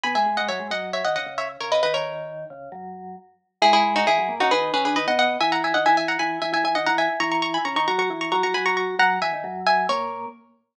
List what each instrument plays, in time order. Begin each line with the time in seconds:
0.04 vibraphone B2 B3, pizzicato strings G#5 B5
0.15 vibraphone G#2 G#3, pizzicato strings E5 G#5
0.26 vibraphone G#2 G#3
0.37 vibraphone G#2 G#3, pizzicato strings D#5 F#5
0.49 vibraphone F#2 F#3, pizzicato strings C#5 E5
0.59 vibraphone G#2 G#3
0.71 vibraphone F#2 F#3, pizzicato strings D#5 F#5
0.93 pizzicato strings C#5 E5
1.05 vibraphone D#2 D#3, pizzicato strings D#5 F#5
1.16 vibraphone C#2 C#3, pizzicato strings D#5 F#5
1.26 vibraphone C#2 C#3
1.38 pizzicato strings C#5 E5
1.61 vibraphone C#2 C#3, pizzicato strings A#4 C#5
1.72 pizzicato strings B4 D#5
1.83 vibraphone D#2 D#3, pizzicato strings B4 D#5
1.94 pizzicato strings A#4 C#5
2.50 vibraphone C#2 C#3
2.72 vibraphone F#2 F#3
3.62 vibraphone G#2 G#3, pizzicato strings E4 G#4
3.73 pizzicato strings E4 G#4
3.96 pizzicato strings D#4 F#4
4.07 vibraphone E2 E3, pizzicato strings E4 G#4
4.19 vibraphone F#2 F#3
4.29 vibraphone A#2 A#3
4.40 vibraphone C#3 C#4, pizzicato strings D#4 F#4
4.51 vibraphone D#3 D#4, pizzicato strings G#4 B4
4.74 vibraphone C#3 C#4, pizzicato strings G#4 B4
4.85 vibraphone D3 D4, pizzicato strings G#4 B4
4.96 vibraphone D#3 D#4, pizzicato strings B4 D#5
5.07 vibraphone B2 B3, pizzicato strings D#5 F#5
5.19 pizzicato strings D#5 F#5
5.41 vibraphone E3 E4, pizzicato strings E5 G#5
5.52 pizzicato strings F#5 A#5
5.64 pizzicato strings E5 G#5
5.74 vibraphone D#3 D#4, pizzicato strings D#5 F#5
5.86 vibraphone E3 E4, pizzicato strings E5 G#5
5.97 pizzicato strings E5 G#5
6.08 pizzicato strings F#5 A#5
6.19 vibraphone E3 E4, pizzicato strings G#5 B5
6.42 vibraphone E3 E4, pizzicato strings E5 G#5
6.53 vibraphone E3 E4, pizzicato strings E5 G#5
6.64 vibraphone E3 E4, pizzicato strings E5 G#5
6.75 vibraphone D#3 D#4, pizzicato strings D#5 F#5
6.86 vibraphone E3 E4, pizzicato strings F#5 A#5
6.98 pizzicato strings E5 G#5
7.20 vibraphone E3 E4, pizzicato strings A#5 C#6
7.32 pizzicato strings A#5 C#6
7.42 pizzicato strings A#5 C#6
7.54 pizzicato strings G#5 B5
7.65 vibraphone C#3 C#4, pizzicato strings A#5 C#6
7.76 vibraphone D#3 D#4, pizzicato strings A#5 C#6
7.87 vibraphone F#3 F#4, pizzicato strings A#5 C#6
7.99 vibraphone F#3 F#4, pizzicato strings A#5 C#6
8.10 vibraphone E3 E4
8.21 pizzicato strings A#5 C#6
8.32 vibraphone F#3 F#4, pizzicato strings A#5 C#6
8.43 vibraphone F#3 F#4, pizzicato strings A#5 C#6
8.54 vibraphone F#3 F#4, pizzicato strings G#5 B5
8.66 vibraphone F#3 F#4, pizzicato strings A#5 C#6
8.77 pizzicato strings A#5 C#6
8.99 vibraphone F#2 F#3, pizzicato strings F#5 A#5
9.22 vibraphone E2 E3, pizzicato strings E5 G#5
9.33 vibraphone D#2 D#3
9.44 vibraphone F#2 F#3
9.67 pizzicato strings E5 G#5
9.89 vibraphone A#2 A#3, pizzicato strings A#4 C#5